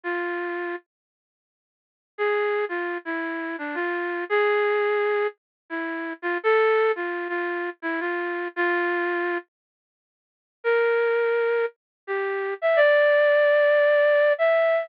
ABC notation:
X:1
M:4/4
L:1/8
Q:"Swing" 1/4=113
K:F
V:1 name="Flute"
F3 z5 | _A2 F E2 D F2 | _A4 z E2 F | A2 F F2 E F2 |
F3 z5 | B4 z G2 e | d6 e2 |]